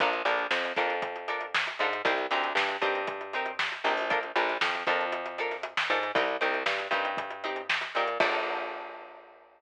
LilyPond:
<<
  \new Staff \with { instrumentName = "Pizzicato Strings" } { \time 4/4 \key bes \mixolydian \tempo 4 = 117 <d' f' a' bes'>8 <d' f' a' bes'>4 <d' f' a' bes'>4 <d' f' a' bes'>4 <d' f' a' bes'>8 | <c' ees' g' bes'>8 <c' ees' g' bes'>4 <c' ees' g' bes'>4 <c' ees' g' bes'>4 <c' ees' g' bes'>8 | <d' f' a' bes'>8 <d' f' a' bes'>4 <d' f' a' bes'>4 <d' f' a' bes'>4 <d' f' a' bes'>8 | <c' ees' g' bes'>8 <c' ees' g' bes'>4 <c' ees' g' bes'>4 <c' ees' g' bes'>4 <c' ees' g' bes'>8 |
<d' f' a' bes'>1 | }
  \new Staff \with { instrumentName = "Electric Bass (finger)" } { \clef bass \time 4/4 \key bes \mixolydian bes,,8 bes,,8 f,8 f,2 aes,8 | c,8 d,8 g,8 g,2 bes,,8~ | bes,,8 bes,,8 f,8 f,2 aes,8 | c,8 c,8 g,8 g,2 bes,8 |
bes,,1 | }
  \new DrumStaff \with { instrumentName = "Drums" } \drummode { \time 4/4 <hh bd>16 hh16 hh16 hh16 sn16 hh16 <hh bd sn>16 hh16 <hh bd>16 hh16 hh16 hh16 sn16 <hh sn>16 hh16 hh16 | <hh bd>16 hh16 hh16 hh16 sn16 hh16 <hh bd>16 hh16 <hh bd>16 hh16 hh16 hh16 sn16 <hh sn>16 hh16 hho16 | <hh bd>16 hh16 hh16 <hh sn>16 sn16 hh16 <hh bd sn>16 hh16 hh16 hh16 hh16 <hh sn>16 hh16 sn16 <hh sn>16 hh16 | <hh bd>16 hh16 hh16 hh16 sn16 hh16 <hh bd>16 hh16 <hh bd>16 hh16 hh16 hh16 sn16 <hh sn>16 hh16 hh16 |
<cymc bd>4 r4 r4 r4 | }
>>